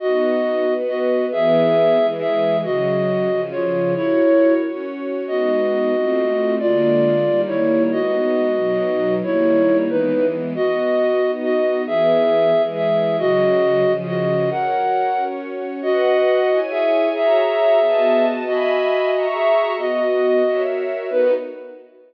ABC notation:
X:1
M:6/8
L:1/8
Q:3/8=91
K:B
V:1 name="Flute"
[Fd]4 [Fd]2 | [Ge]4 [Ge]2 | [Fd]4 [^Ec]2 | [Ec]3 z3 |
[K:G#m] [Fd]6 | [^E=d]4 [=Ec]2 | [Fd]6 | [Ec]3 [DB]2 z |
[K:B] [Fd]4 [Fd]2 | [Ge]4 [Ge]2 | [Fd]4 [Fd]2 | [Af]4 z2 |
[Fd]4 [Ge]2 | [Ge]6 | [Fd]4 [Ge]2 | [Fd]4 z2 |
B3 z3 |]
V:2 name="String Ensemble 1"
[B,DF]3 [B,FB]3 | [E,B,G]3 [E,G,G]3 | [C,F,G]3 [C,^E,G]3 | [FAc]3 [CFc]3 |
[K:G#m] [G,B,D]3 [=A,^B,^E]3 | [=D,G,A,^E]3 [^D,=G,A,]3 | [G,B,D]3 [B,,F,D]3 | [D,=G,A,]3 [E,^G,B,]3 |
[K:B] [B,Fd]3 [B,Dd]3 | [E,B,G]3 [E,G,G]3 | [C,F,G]3 [C,^E,G]3 | [FAc]3 [CFc]3 |
[Bdf]3 [Ecg]3 | [Fcea]3 [B,Fd=a]3 | [egb]3 [Feac']3 | [B,Fd]3 [FAce]3 |
[B,DF]3 z3 |]